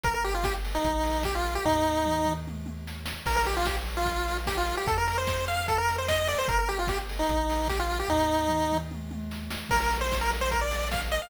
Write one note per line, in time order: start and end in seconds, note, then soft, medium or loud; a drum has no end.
0.04 0.79 G1 medium
0.04 0.14 A#4 loud
0.04 kick loud
0.04 closed hi-hat loud
0.14 0.24 A#4 loud
0.24 0.34 G4 loud
0.24 open hi-hat medium
0.34 0.44 F4 medium
0.44 0.54 G4 loud
0.44 kick loud
0.44 snare loud
0.64 open hi-hat medium
0.75 1.24 D#4 loud
0.84 1.59 A#1 medium
0.84 kick medium
0.84 closed hi-hat loud
1.03 open hi-hat medium
1.23 1.35 G4 loud
1.23 kick medium
1.23 snare medium
1.35 1.54 F4 loud
1.44 open hi-hat medium
1.55 1.65 G4 loud
1.65 3.14 D#2 medium
1.65 2.33 D#4 loud
1.65 kick medium
1.65 floor tom medium
2.06 mid tom medium
2.25 mid tom medium
2.47 high tom medium
2.66 high tom medium
2.87 snare medium
3.06 snare loud
3.26 4.74 A#1 medium
3.26 3.36 A#4 loud
3.26 kick loud
3.26 crash loud
3.36 3.46 A#4 loud
3.45 3.56 G4 loud
3.45 open hi-hat medium
3.57 3.66 F4 loud
3.65 3.76 G4 medium
3.65 kick medium
3.65 snare loud
3.86 open hi-hat medium
3.97 4.37 F4 loud
4.06 kick medium
4.06 closed hi-hat medium
4.28 open hi-hat medium
4.47 4.57 G4 loud
4.47 kick medium
4.47 snare loud
4.57 4.76 F4 loud
4.67 open hi-hat medium
4.77 4.87 G4 loud
4.87 6.35 F2 medium
4.87 4.97 A4 loud
4.87 kick loud
4.87 closed hi-hat loud
4.97 5.07 A#4 loud
5.08 5.17 A#4 loud
5.08 open hi-hat medium
5.18 5.45 C5 loud
5.27 kick medium
5.27 snare loud
5.46 5.67 F5 loud
5.46 open hi-hat medium
5.68 5.78 A4 loud
5.68 kick medium
5.68 closed hi-hat loud
5.78 5.96 A#4 loud
5.88 open hi-hat medium
5.98 6.08 C5 medium
6.08 6.28 D#5 loud
6.08 kick medium
6.08 snare loud
6.27 6.38 D5 loud
6.27 open hi-hat medium
6.38 6.48 C5 loud
6.48 7.23 G1 medium
6.48 6.58 A#4 loud
6.48 kick loud
6.48 closed hi-hat loud
6.59 6.68 A#4 loud
6.69 6.78 G4 loud
6.69 open hi-hat medium
6.79 6.88 F4 medium
6.87 6.98 G4 loud
6.87 kick loud
6.87 snare loud
7.09 open hi-hat medium
7.19 7.68 D#4 loud
7.29 8.03 A#1 medium
7.29 kick medium
7.29 closed hi-hat loud
7.49 open hi-hat medium
7.68 7.79 G4 loud
7.68 kick medium
7.68 snare medium
7.79 7.99 F4 loud
7.91 open hi-hat medium
7.99 8.09 G4 loud
8.08 9.57 D#2 medium
8.08 8.78 D#4 loud
8.08 kick medium
8.08 floor tom medium
8.48 mid tom medium
8.72 mid tom medium
8.91 high tom medium
9.11 high tom medium
9.31 snare medium
9.51 snare loud
9.69 11.19 A#1 medium
9.69 9.80 A#4 loud
9.69 kick loud
9.69 crash loud
9.81 9.98 A#4 loud
9.91 open hi-hat medium
10.01 10.17 C5 loud
10.12 kick medium
10.12 snare loud
10.21 10.31 A#4 loud
10.31 open hi-hat medium
10.41 10.51 C5 loud
10.51 10.61 A#4 loud
10.51 kick medium
10.51 closed hi-hat loud
10.61 10.88 D5 medium
10.71 open hi-hat medium
10.91 11.01 F5 medium
10.91 kick medium
10.91 snare loud
11.11 11.21 D#5 loud
11.11 open hi-hat medium
11.22 11.30 F5 loud